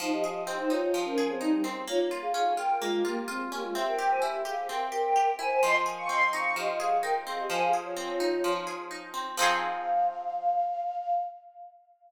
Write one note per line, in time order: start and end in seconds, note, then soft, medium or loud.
0.00 0.93 F3 medium
0.00 0.10 D#4 loud
0.00 0.10 C5 loud
0.12 0.24 G4 medium
0.12 0.24 D#5 loud
0.24 0.34 G4 medium
0.24 1.17 G#4 medium
0.24 0.34 D#5 medium
0.34 0.55 G4 medium
0.34 0.55 D#5 loud
0.47 1.63 C4 medium
0.58 0.70 D#4 medium
0.58 0.70 C5 medium
0.70 1.40 D#4 medium
0.70 0.81 F4 medium
0.70 0.81 C#5 loud
0.82 1.03 F4 medium
0.82 1.03 C#5 loud
0.94 1.83 F3 medium
1.05 1.26 C#4 loud
1.05 1.26 A#4 loud
1.18 1.84 G#4 medium
1.30 1.41 C4 loud
1.30 1.41 G#4 loud
1.40 1.62 G3 medium
1.40 1.62 D#4 loud
1.40 1.85 D#4 medium
1.64 1.86 C4 medium
1.88 2.81 A#3 medium
1.88 2.00 F4 loud
1.88 2.00 C#5 loud
2.11 2.57 F4 medium
2.22 2.33 G#4 loud
2.22 2.33 F5 loud
2.34 3.51 C#4 medium
2.34 2.54 G#4 medium
2.34 2.54 F5 medium
2.57 3.04 F4 medium
2.57 2.78 A#4 medium
2.57 2.78 G5 loud
2.80 3.03 G#3 medium
2.80 3.71 A#3 medium
2.80 3.03 F4 medium
3.05 3.25 A#3 medium
3.05 3.27 F4 medium
3.05 3.25 G4 loud
3.28 3.40 C4 medium
3.28 3.72 F4 medium
3.28 3.40 G#4 loud
3.52 3.63 A#3 medium
3.52 3.74 C#4 medium
3.52 3.63 G4 medium
3.63 3.74 G#3 medium
3.63 3.74 F4 medium
3.74 4.69 C4 medium
3.74 3.85 G4 loud
3.74 3.85 E5 loud
3.87 4.10 A#4 medium
3.87 4.10 G5 loud
3.99 4.45 G4 medium
4.10 4.21 C5 medium
4.10 4.21 G#5 medium
4.22 5.38 E4 medium
4.22 4.43 G4 medium
4.22 4.43 E5 loud
4.45 4.91 G4 medium
4.45 4.68 G#4 medium
4.45 4.68 F5 loud
4.69 5.58 C4 medium
4.69 4.79 A#4 medium
4.69 4.79 G5 loud
4.80 4.91 A#4 medium
4.80 4.91 G5 loud
4.92 5.15 G4 medium
4.92 5.32 A#4 medium
4.92 5.32 G5 loud
5.16 5.60 G4 medium
5.39 5.61 E4 medium
5.39 5.50 C5 loud
5.39 5.50 G#5 loud
5.50 5.61 C5 medium
5.50 5.61 G#5 loud
5.63 6.56 F3 medium
5.63 5.75 D#5 loud
5.63 5.75 C6 loud
5.86 6.79 G#4 medium
5.98 6.09 F5 medium
5.98 6.09 C#6 loud
6.08 7.26 C4 medium
6.08 6.29 D#5 medium
6.08 6.29 C6 medium
6.33 7.03 D#4 medium
6.33 6.55 F5 medium
6.33 6.55 C#6 loud
6.56 7.45 F3 medium
6.56 6.78 G4 medium
6.56 6.78 D#5 loud
6.80 7.47 G#4 medium
6.80 7.03 G#4 medium
6.80 7.03 F5 medium
7.03 7.48 D#4 medium
7.03 7.14 A#4 medium
7.03 7.14 G5 loud
7.27 7.49 C4 medium
7.27 7.38 G#4 medium
7.27 7.38 F5 medium
7.39 7.50 G4 medium
7.39 7.50 D#5 medium
7.50 8.44 F3 medium
7.50 7.61 C5 loud
7.50 7.61 G#5 loud
7.60 7.72 G#4 medium
7.60 7.72 F5 loud
7.73 8.66 G#4 medium
7.85 8.54 F4 medium
7.85 8.54 C#5 loud
7.96 9.13 C4 medium
8.20 8.90 D#4 medium
8.44 9.33 F3 medium
8.67 9.34 G#4 medium
8.91 9.35 D#4 medium
9.14 9.36 C4 medium
9.37 11.16 F3 loud
9.37 11.16 C4 loud
9.37 11.16 D#4 loud
9.37 11.16 F5 loud
9.42 11.16 G#4 loud